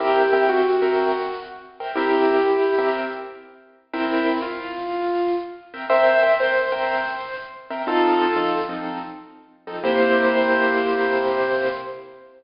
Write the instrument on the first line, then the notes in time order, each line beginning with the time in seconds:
acoustic grand piano
0.00 C4 E4 G4 A#4 E5 G5
0.33 C4 A#4 E5 G5
0.49 F#4
0.82 C4 A#4 E5 G5
1.80 C4 A#4 E5 G5
1.95 C4 E4 G4 A#4 E5 G5
2.78 C4 A#4 E5 G5
3.93 C4 E4 A#4 E5 G5
4.42 F4
5.74 C4 A#4 E5 G5
5.90 C4 A#4 C5 E5 G5
6.23 C4 A#4 E5 G5
6.40 C5
6.72 C4 A#4 E5 G5
7.70 C4 A#4 E5 G5
7.87 F3 C4 D#4 F4 A4
8.36 F3 C4 D#4 A4
8.69 F3 C4 D#4 A4
9.67 F3 C4 D#4 A4
9.84 C3 A#3 E4 G4 C5